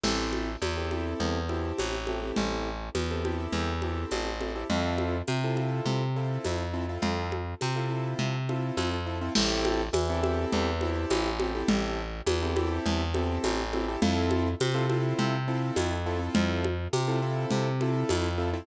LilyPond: <<
  \new Staff \with { instrumentName = "Acoustic Grand Piano" } { \time 4/4 \key a \minor \tempo 4 = 103 <c' e' g' a'>4~ <c' e' g' a'>16 <c' e' g' a'>16 <c' e' g' a'>4 <c' e' g' a'>4 <c' e' g' a'>16 <c' e' g' a'>16~ | <c' e' g' a'>4~ <c' e' g' a'>16 <c' e' g' a'>16 <c' e' g' a'>4 <c' e' g' a'>4 <c' e' g' a'>16 <c' e' g' a'>16 | <c' e' f' a'>4~ <c' e' f' a'>16 <c' e' f' a'>16 <c' e' f' a'>4 <c' e' f' a'>4 <c' e' f' a'>16 <c' e' f' a'>16~ | <c' e' f' a'>4~ <c' e' f' a'>16 <c' e' f' a'>16 <c' e' f' a'>4 <c' e' f' a'>4 <c' e' f' a'>16 <c' e' f' a'>16 |
<c' e' g' a'>4~ <c' e' g' a'>16 <c' e' g' a'>16 <c' e' g' a'>4 <c' e' g' a'>4 <c' e' g' a'>16 <c' e' g' a'>16~ | <c' e' g' a'>4~ <c' e' g' a'>16 <c' e' g' a'>16 <c' e' g' a'>4 <c' e' g' a'>4 <c' e' g' a'>16 <c' e' g' a'>16 | <c' e' f' a'>4~ <c' e' f' a'>16 <c' e' f' a'>16 <c' e' f' a'>4 <c' e' f' a'>4 <c' e' f' a'>16 <c' e' f' a'>16~ | <c' e' f' a'>4~ <c' e' f' a'>16 <c' e' f' a'>16 <c' e' f' a'>4 <c' e' f' a'>4 <c' e' f' a'>16 <c' e' f' a'>16 | }
  \new Staff \with { instrumentName = "Electric Bass (finger)" } { \clef bass \time 4/4 \key a \minor a,,4 e,4 e,4 a,,4 | a,,4 e,4 e,4 a,,4 | f,4 c4 c4 f,4 | f,4 c4 c4 f,4 |
a,,4 e,4 e,4 a,,4 | a,,4 e,4 e,4 a,,4 | f,4 c4 c4 f,4 | f,4 c4 c4 f,4 | }
  \new DrumStaff \with { instrumentName = "Drums" } \drummode { \time 4/4 <cgl cymc>8 cgho8 <cgho tamb>8 cgho8 cgl8 cgho8 <cgho tamb>8 cgho8 | cgl4 <cgho tamb>8 cgho8 cgl8 cgho8 <cgho tamb>8 cgho8 | cgl8 cgho8 <cgho tamb>8 cgho8 cgl4 <cgho tamb>4 | cgl8 cgho8 <cgho tamb>4 cgl8 cgho8 <cgho tamb>4 |
<cgl cymc>8 cgho8 <cgho tamb>8 cgho8 cgl8 cgho8 <cgho tamb>8 cgho8 | cgl4 <cgho tamb>8 cgho8 cgl8 cgho8 <cgho tamb>8 cgho8 | cgl8 cgho8 <cgho tamb>8 cgho8 cgl4 <cgho tamb>4 | cgl8 cgho8 <cgho tamb>4 cgl8 cgho8 <cgho tamb>4 | }
>>